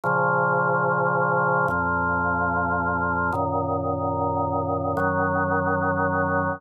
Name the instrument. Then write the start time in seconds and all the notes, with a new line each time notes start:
drawbar organ
0.03 A#2 C#3 F3
1.68 F2 A#2 F3
3.32 F#2 A#2 D#3
4.97 F#2 D#3 F#3